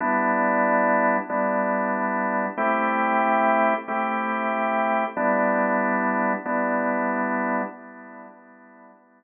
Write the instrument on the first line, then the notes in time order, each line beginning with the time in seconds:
drawbar organ
0.01 G3 B3 D4 E4
1.29 G3 B3 D4 E4
2.58 A3 C4 E4 G4
3.88 A3 C4 E4 G4
5.17 G3 B3 D4 E4
6.45 G3 B3 D4 E4